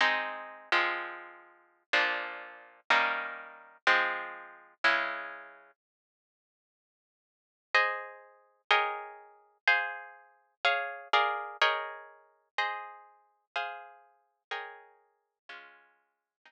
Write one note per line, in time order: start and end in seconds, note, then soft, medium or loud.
0.01 0.70 G#3 medium
0.01 0.70 C4 medium
0.01 0.70 D#4 medium
0.72 1.83 F3 medium
0.72 1.83 G#3 medium
0.72 1.83 C4 medium
1.93 2.80 A#2 medium
1.93 2.80 F3 medium
1.93 2.80 D4 medium
2.90 3.77 D#3 medium
2.90 3.77 G3 medium
2.90 3.77 A#3 medium
2.90 3.77 C#4 medium
3.87 4.74 F3 medium
3.87 4.74 G#3 medium
3.87 4.74 C4 medium
4.84 5.71 C#3 medium
4.84 5.71 G#3 medium
4.84 5.71 E4 medium
7.74 8.62 G#4 medium
7.74 8.62 C5 medium
7.74 8.62 D#5 medium
8.71 9.58 G#4 medium
8.71 9.58 A#4 medium
8.71 9.58 C#5 medium
8.71 9.58 D#5 medium
8.71 9.58 G5 medium
9.68 10.55 G#4 medium
9.68 10.55 C5 medium
9.68 10.55 F5 medium
10.65 11.08 G#4 medium
10.65 11.08 C#5 medium
10.65 11.08 F5 medium
11.13 11.57 G#4 medium
11.13 11.57 A#4 medium
11.13 11.57 D5 medium
11.13 11.57 F5 medium
11.61 12.49 G#4 medium
11.61 12.49 A#4 medium
11.61 12.49 C#5 medium
11.61 12.49 D#5 medium
11.61 12.49 G5 medium
12.58 13.45 G#4 medium
12.58 13.45 C5 medium
12.58 13.45 D#5 medium
13.56 14.43 G#4 medium
13.56 14.43 C5 medium
13.56 14.43 F5 medium
14.51 15.38 G#4 medium
14.51 15.38 A#4 medium
14.51 15.38 C#5 medium
14.51 15.38 D#5 medium
14.51 15.38 G5 medium
15.49 16.36 G#3 medium
15.49 16.36 C#4 medium
15.49 16.36 F4 medium
16.45 16.52 G#3 medium
16.45 16.52 C4 medium
16.45 16.52 D#4 medium